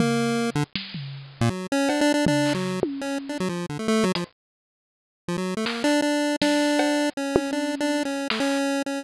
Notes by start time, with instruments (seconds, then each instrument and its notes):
0.00 lead 1 (square) A#3, floor tom
0.55 lead 1 (square) D3
0.75 snare
0.94 floor tom
1.41 lead 1 (square) A#2
1.50 lead 1 (square) F#3
1.72 lead 1 (square) C#4
1.89 lead 1 (square) D4, cowbell
2.01 lead 1 (square) D4
2.14 lead 1 (square) D4
2.26 lead 1 (square) D4, floor tom
2.45 clap
2.54 lead 1 (square) F#3
2.83 high tom
3.01 lead 1 (square) C#4
3.29 lead 1 (square) D4
3.40 lead 1 (square) F#3
3.49 lead 1 (square) F3
3.69 lead 1 (square) D3
3.79 lead 1 (square) A3
3.88 lead 1 (square) A3
4.04 lead 1 (square) F#3
4.15 lead 1 (square) F3, closed hi-hat
5.28 lead 1 (square) F3
5.38 lead 1 (square) F#3
5.57 lead 1 (square) A3
5.66 lead 1 (square) A#3, clap
5.84 lead 1 (square) D4
6.02 lead 1 (square) D4
6.42 lead 1 (square) D4, snare
6.79 cowbell
7.17 lead 1 (square) C#4
7.36 high tom
7.53 lead 1 (square) D4
7.80 lead 1 (square) D4
8.05 lead 1 (square) C#4
8.30 lead 1 (square) A3, clap
8.40 lead 1 (square) C#4
8.86 lead 1 (square) C#4